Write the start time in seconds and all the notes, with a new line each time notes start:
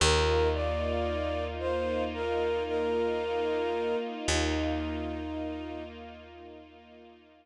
0.00 D#2 A#3 D#4 F4 A#4
0.54 D5
1.59 C5
2.14 A#4
2.67 A#4
4.28 D#2 D#4